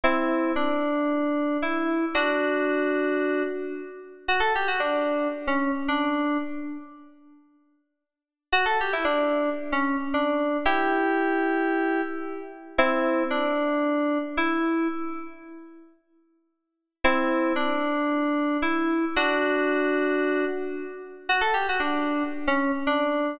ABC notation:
X:1
M:4/4
L:1/16
Q:1/4=113
K:Em
V:1 name="Electric Piano 2"
[CE]4 D8 E4 | [DF]10 z6 | [K:Bm] F A G F D4 z C2 z D4 | z16 |
F A G E D4 z C2 z D4 | [EG]12 z4 | [K:Em] [CE]4 D8 E4 | z16 |
[CE]4 D8 E4 | [DF]10 z6 | [K:Bm] F A G F D4 z C2 z D4 |]